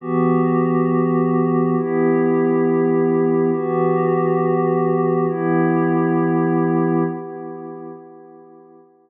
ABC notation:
X:1
M:4/4
L:1/8
Q:1/4=68
K:Em
V:1 name="Pad 5 (bowed)"
[E,B,FG]4 [E,B,EG]4 | [E,B,FG]4 [E,B,EG]4 | z8 |]